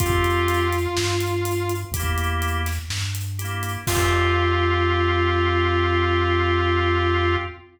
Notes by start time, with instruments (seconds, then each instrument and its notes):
0.00 synth bass 1 F2, distortion guitar F4, drawbar organ F4 G4, kick, closed hi-hat
0.06 drawbar organ C4
0.24 closed hi-hat
0.48 closed hi-hat
0.73 closed hi-hat
0.97 synth bass 1 G2, snare
1.21 closed hi-hat
1.45 closed hi-hat
1.69 closed hi-hat
1.92 synth bass 1 E2, drawbar organ G4, kick, closed hi-hat
1.96 drawbar organ A#3 E4
2.18 closed hi-hat
2.42 closed hi-hat
2.66 snare, closed hi-hat
2.90 synth bass 1 G2, snare
3.15 closed hi-hat
3.39 drawbar organ E4 G4, closed hi-hat
3.44 drawbar organ A#3
3.63 closed hi-hat
3.87 synth bass 1 F2, distortion guitar F4, drawbar organ F4 G4, kick, crash
3.93 drawbar organ C4